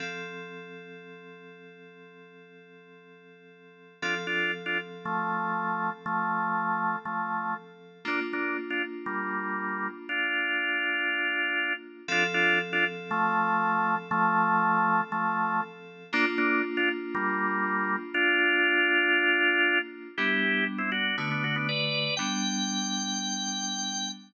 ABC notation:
X:1
M:4/4
L:1/16
Q:1/4=119
K:F
V:1 name="Drawbar Organ"
z16 | z16 | [DF] z [DF]2 z [DF] z2 [F,A,]8 | [F,A,]8 [F,A,]4 z4 |
[B,D] z [B,D]2 z [DF] z2 [G,B,]8 | [DF]14 z2 | [DF] z [DF]2 z [DF] z2 [F,A,]8 | [F,A,]8 [F,A,]4 z4 |
[B,D] z [B,D]2 z [DF] z2 [G,B,]8 | [DF]14 z2 | [K:G] [EG]4 z [CE] [DF]2 [B,D] [B,D] [DF] [B,D] [Bd]4 | g16 |]
V:2 name="Electric Piano 2"
[F,CA]16- | [F,CA]16 | [F,CA]16- | [F,CA]16 |
[B,DF]16- | [B,DF]16 | [F,CA]16- | [F,CA]16 |
[B,DF]16- | [B,DF]16 | [K:G] [G,B,D]8 [D,A,F]8 | [G,B,D]16 |]